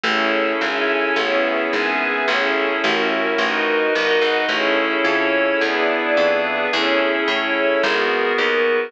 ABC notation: X:1
M:4/4
L:1/8
Q:1/4=108
K:Alyd
V:1 name="Pad 5 (bowed)"
[CEGA]2 [CEAc]2 [B,CEG]2 [B,CGB]2 | [CEGA]2 [CEF^A]2 [DFAB]2 [DFBd]2 | [CEGA]2 [CEAc]2 [B,=DEG]2 [B,DGB]2 | [CEGA]2 [CEAc]2 [B,FG^A]2 [B,FAB]2 |]
V:2 name="String Ensemble 1"
[GAce]2 [GAeg]2 [GBce]2 [GBeg]2 | [GAce]2 [F^Ace]2 [FABd]2 [FAdf]2 | [GAce]4 [GB=de]4 | [GAce]4 [FG^AB]4 |]
V:3 name="Electric Bass (finger)" clef=bass
A,,,2 G,,,2 A,,,2 G,,,2 | A,,,2 A,,,2 A,,,2 =G,,, ^G,,, | A,,,2 =F,,2 E,,2 F,,2 | E,,2 A,,2 G,,,2 D,,2 |]